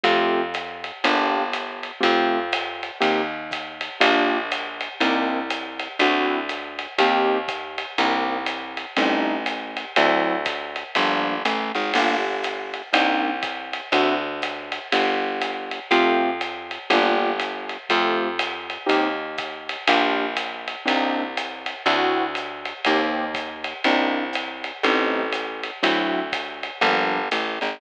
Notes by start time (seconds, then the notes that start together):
0.03 F2 A3 C4 F4 G4, ride
0.54 hi-hat pedal, ride
0.84 ride
1.04 G1 A#3 D4 F4 G4, ride
1.53 hi-hat pedal, ride
1.83 ride
2.00 F2 A3 C4 F4 G4, kick, ride
2.52 hi-hat pedal, ride
2.83 ride
3.01 D#2 A#3 C4 D#4 G4, ride
3.51 kick, hi-hat pedal, ride
3.81 ride
4.00 A#1 A#3 D4 F4 G4, kick, ride
4.51 hi-hat pedal, ride
4.81 ride
5.00 C2 A#3 C4 D4 D#4, ride
5.50 hi-hat pedal, ride
5.79 ride
5.99 D2 C4 D4 E4 F#4, ride
6.49 hi-hat pedal, ride
6.79 ride
6.98 D#2 A#3 C4 D#4 G4, ride
7.48 kick, hi-hat pedal, ride
7.78 ride
7.98 C2 A#3 C4 D4 D#4, ride
8.46 hi-hat pedal, ride
8.77 ride
8.96 A1 G3 A3 C4 D#4, ride
9.46 hi-hat pedal, ride
9.77 ride
9.96 D2 F#3 C4 D4 E4, ride
10.45 kick, hi-hat pedal, ride
10.76 ride
10.95 G1 F3 G3 A#3 D4, kick, ride
11.45 A1 A3, hi-hat pedal, ride
11.74 G#1 G#3, ride
11.94 G1 A#3 D4 F4 G4, crash, ride
12.44 hi-hat pedal, ride
12.74 ride
12.93 C2 A#3 C4 D4 D#4, ride
13.43 kick, hi-hat pedal, ride
13.73 ride
13.92 D2 C4 D4 E4 F#4, ride
14.42 hi-hat pedal, ride
14.72 ride
14.92 G1, ride
15.41 hi-hat pedal, ride
15.71 ride
15.91 F2 A3 C4 F4 G4, ride
16.41 hi-hat pedal, ride
16.71 ride
16.90 G1 A#3 D4 F4 G4, ride
17.39 hi-hat pedal, ride
17.69 ride
17.89 F2 A3 C4 F4 G4, kick, ride
18.39 hi-hat pedal, ride
18.70 ride
18.86 D#2 A#3 C4 D#4 G4, ride
19.38 kick, hi-hat pedal, ride
19.69 ride
19.87 A#1 A#3 D4 F4 G4, kick, ride
20.37 hi-hat pedal, ride
20.68 ride
20.85 C2 A#3 C4 D4 D#4, ride
21.37 hi-hat pedal, ride
21.66 ride
21.86 D2 C4 D4 E4 F#4, ride
22.35 hi-hat pedal, ride
22.65 ride
22.85 D#2 A#3 C4 D#4 G4, ride
23.34 kick, hi-hat pedal, ride
23.64 ride
23.84 C2 A#3 C4 D4 D#4, ride
24.33 hi-hat pedal, ride
24.64 ride
24.83 A1 G3 A3 C4 D#4, ride
25.32 hi-hat pedal, ride
25.63 ride
25.83 D2 F#3 C4 D4 E4, ride
26.32 kick, hi-hat pedal, ride
26.63 ride
26.81 G1 F3 G3 A#3 D4, kick, ride
27.31 A1 A3, hi-hat pedal, ride
27.61 G#1 G#3, ride